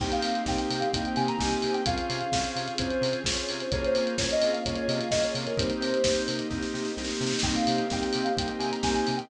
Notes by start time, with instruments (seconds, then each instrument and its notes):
0.00 synth bass 1 C2, drawbar organ A#3 C4 D#4 G4, string ensemble 1 A#3 C4 D#4 G4, ocarina G5, kick, crash
0.12 ocarina F5, closed hi-hat
0.22 synth bass 1 C3, open hi-hat
0.35 closed hi-hat
0.46 synth bass 1 C2, drawbar organ A#3 C4 D#4 G4, ocarina G5, kick, snare
0.57 ocarina G5, closed hi-hat
0.70 synth bass 1 C3, open hi-hat
0.80 ocarina F5, closed hi-hat
0.92 synth bass 1 C2, drawbar organ A#3 C4 D#4 G4, ocarina G5, kick, closed hi-hat
1.05 ocarina G5, closed hi-hat
1.16 synth bass 1 C3, ocarina G#5, open hi-hat
1.28 ocarina A#5, closed hi-hat
1.39 synth bass 1 C2, drawbar organ A#3 C4 D#4 G4, ocarina G#5, kick, snare
1.51 ocarina G#5, closed hi-hat
1.62 synth bass 1 C3, open hi-hat
1.74 ocarina G5, closed hi-hat
1.85 synth bass 1 C2, drawbar organ C4 C#4 F4 G#4, string ensemble 1 C4 C#4 F4 G#4, ocarina F5, kick, closed hi-hat
1.98 closed hi-hat
2.10 synth bass 1 C3, open hi-hat
2.21 closed hi-hat
2.32 synth bass 1 C2, drawbar organ C4 C#4 F4 G#4, kick, snare
2.44 closed hi-hat
2.56 synth bass 1 C3, open hi-hat
2.68 closed hi-hat
2.78 synth bass 1 C2, drawbar organ C4 C#4 F4 G#4, ocarina C5, kick, closed hi-hat
2.90 closed hi-hat
3.01 synth bass 1 C3, open hi-hat
3.13 closed hi-hat
3.24 synth bass 1 C2, drawbar organ C4 C#4 F4 G#4, ocarina C#5, kick, snare
3.37 closed hi-hat
3.49 synth bass 1 C3, open hi-hat
3.60 ocarina C5, closed hi-hat
3.71 synth bass 1 C2, string ensemble 1 A#3 C#4 F4 G#4, drawbar organ A#3 C#4 F4 G#4, ocarina C#5, kick, closed hi-hat
3.84 ocarina C5, closed hi-hat
3.95 synth bass 1 C3, open hi-hat
4.07 closed hi-hat
4.18 synth bass 1 C2, drawbar organ A#3 C#4 F4 G#4, ocarina C#5, kick, snare
4.31 ocarina D#5, closed hi-hat
4.42 synth bass 1 C3, open hi-hat
4.53 ocarina F5, closed hi-hat
4.65 synth bass 1 C2, drawbar organ A#3 C#4 F4 G#4, ocarina C#5, kick, closed hi-hat
4.75 ocarina C#5, closed hi-hat
4.88 synth bass 1 C3, ocarina D#5, open hi-hat
5.00 ocarina F5, closed hi-hat
5.11 synth bass 1 C2, drawbar organ A#3 C#4 F4 G#4, ocarina D#5, kick, snare
5.24 ocarina C#5, closed hi-hat
5.35 synth bass 1 C3, open hi-hat
5.47 ocarina A#4, closed hi-hat
5.57 synth bass 1 C2, drawbar organ A#3 C4 D#4 G4, string ensemble 1 A#3 C4 D#4 G4, ocarina C5, kick, closed hi-hat
5.70 closed hi-hat
5.80 synth bass 1 C3, open hi-hat
5.94 closed hi-hat
6.04 synth bass 1 C2, drawbar organ A#3 C4 D#4 G4, kick, snare
6.15 closed hi-hat
6.28 synth bass 1 C3, open hi-hat
6.39 closed hi-hat
6.50 synth bass 1 C2, drawbar organ A#3 C4 D#4 G4, kick, snare
6.62 snare
6.74 synth bass 1 C3, snare
6.85 snare
6.97 synth bass 1 C2, drawbar organ A#3 C4 D#4 G4, snare
7.04 snare
7.10 snare
7.15 snare
7.21 synth bass 1 C3, snare
7.27 snare
7.33 snare
7.39 ocarina G5, kick, snare
7.43 synth bass 1 C2, drawbar organ A#3 C4 D#4 G4, string ensemble 1 A#3 C4 D#4 G4, crash
7.55 ocarina F5, closed hi-hat
7.67 synth bass 1 C3, open hi-hat
7.78 closed hi-hat
7.90 synth bass 1 C2, drawbar organ A#3 C4 D#4 G4, ocarina G5, kick, snare
8.01 ocarina G5, closed hi-hat
8.13 synth bass 1 C3, open hi-hat
8.24 ocarina F5, closed hi-hat
8.37 synth bass 1 C2, drawbar organ A#3 C4 D#4 G4, ocarina G5, kick, closed hi-hat
8.48 ocarina G5, closed hi-hat
8.59 synth bass 1 C3, ocarina G#5, open hi-hat
8.72 ocarina A#5, closed hi-hat
8.83 synth bass 1 C2, drawbar organ A#3 C4 D#4 G4, ocarina G#5, kick, snare
8.94 ocarina G#5, closed hi-hat
9.07 synth bass 1 C3, open hi-hat
9.17 ocarina G5, closed hi-hat